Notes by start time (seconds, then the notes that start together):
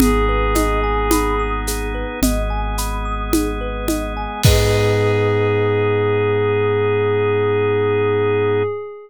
0.00 G#1 B3 D#4 G#4, low conga, shaker
0.29 B4
0.55 D#5, high conga, shaker
0.84 G#5
1.11 B5, high conga, shaker
1.40 D#6
1.67 G#4, shaker
1.94 B4
2.22 G#1 G#3 B3 G#4 D#5, low conga, shaker
2.50 G#5
2.78 B5, shaker
3.05 D#6
3.33 G#4, high conga, shaker
3.61 B4
3.88 D#5, high conga, shaker
4.17 G#5
4.44 G#2 B3 D#4 G#4 B4 D#5, kick, crash